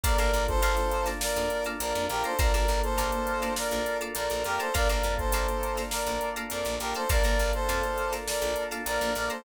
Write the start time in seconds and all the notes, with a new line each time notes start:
0.03 A#1 A#3 D4 F4 A4 A#4 D5 F5 A5 A#5, kick, closed hi-hat
0.18 A#1 A#4 D5 F5 A5 A#5, closed hi-hat
0.33 A#1, closed hi-hat
0.48 A4 C5, kick, closed hi-hat
0.62 A#1 D5 F5 A5 A#5, closed hi-hat
0.77 snare, closed hi-hat
0.91 closed hi-hat
1.06 D5 F5 A5 A#5, snare, closed hi-hat
1.21 A#4 D5, snare
1.36 F2, snare, closed hi-hat
1.50 closed hi-hat
1.64 D5 F5 A5 A#5, snare, closed hi-hat
1.80 A#1 A#4 D5, closed hi-hat
1.95 F2, closed hi-hat
2.09 A#1 G4 A#4, closed hi-hat
2.24 A4 C5 D5 F5 A5 A#5, closed hi-hat
2.39 A#1 A#3 D4 F4 A4 A#4 D5 F5 A5 A#5, kick, closed hi-hat
2.54 A#1 A#4 D5 F5 A5 A#5, closed hi-hat
2.68 A#1, closed hi-hat
2.83 A4 C5, closed hi-hat
2.98 A#1 D5 F5 A5 A#5, closed hi-hat
3.12 closed hi-hat
3.27 closed hi-hat
3.42 D5 F5 A5 A#5, snare, closed hi-hat
3.56 A#4 D5, snare
3.71 A#1, snare, closed hi-hat
3.86 snare, closed hi-hat
4.01 D5 F5 A5 A#5, closed hi-hat
4.15 A#1 A#4 D5, closed hi-hat
4.30 A#1, closed hi-hat
4.44 F2 G4 A#4, closed hi-hat
4.59 A4 C5 D5 F5 A5 A#5, closed hi-hat
4.74 A#1 A#3 D4 F4 A4 A#4 D5 F5 A5 A#5, kick, closed hi-hat
4.88 A#1 A#4 D5 F5 A5 A#5, snare, closed hi-hat
5.03 F2, closed hi-hat
5.18 A4 C5, kick, closed hi-hat
5.32 A#1 D5 F5 A5 A#5, closed hi-hat
5.48 closed hi-hat
5.63 closed hi-hat
5.77 D5 F5 A5 A#5, snare, closed hi-hat
5.91 A#4 D5, snare
6.07 A#1, closed hi-hat
6.21 closed hi-hat
6.36 D5 F5 A5 A#5, closed hi-hat
6.50 F2 A#4 D5, closed hi-hat
6.65 A#1, closed hi-hat
6.79 A#1 G4 A#4, snare, closed hi-hat
6.94 A4 C5 D5 F5 A5 A#5, closed hi-hat
7.09 A#1 A#3 D4 F4 A4 A#4 D5 F5 A5 A#5, kick, closed hi-hat
7.24 A#1 A#4 D5 F5 A5 A#5, closed hi-hat
7.39 A#1, snare, closed hi-hat
7.53 A4 C5, closed hi-hat
7.69 F2 D5 F5 A5 A#5, closed hi-hat
7.83 snare, closed hi-hat
7.98 closed hi-hat
8.12 D5 F5 A5 A#5, snare, closed hi-hat
8.27 A#4 D5, snare
8.42 A#1, closed hi-hat
8.56 closed hi-hat
8.71 D5 F5 A5 A#5, snare, closed hi-hat
8.86 A#1 A#4 D5, closed hi-hat
9.01 A#1, closed hi-hat
9.15 A#1 A#4 D5, closed hi-hat
9.30 A4 C5 D5 F5 A5 A#5, closed hi-hat